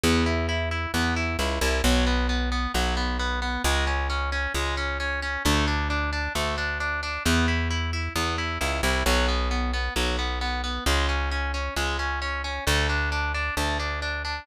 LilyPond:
<<
  \new Staff \with { instrumentName = "Overdriven Guitar" } { \time 4/4 \key b \dorian \tempo 4 = 133 b8 e'8 e'8 e'8 b8 e'8 e'8 e'8 | fis8 b8 b8 b8 fis8 b8 b8 b8 | gis8 cis'8 cis'8 cis'8 gis8 cis'8 cis'8 cis'8 | a8 d'8 d'8 d'8 a8 d'8 d'8 d'8 |
b8 e'8 e'8 e'8 b8 e'8 e'8 e'8 | fis8 b8 b8 b8 fis8 b8 b8 b8 | gis8 cis'8 cis'8 cis'8 gis8 cis'8 cis'8 cis'8 | a8 d'8 d'8 d'8 a8 d'8 d'8 d'8 | }
  \new Staff \with { instrumentName = "Electric Bass (finger)" } { \clef bass \time 4/4 \key b \dorian e,2 e,4 cis,8 c,8 | b,,2 b,,2 | cis,2 cis,2 | d,2 d,2 |
e,2 e,4 cis,8 c,8 | b,,2 b,,2 | cis,2 cis,2 | d,2 d,2 | }
>>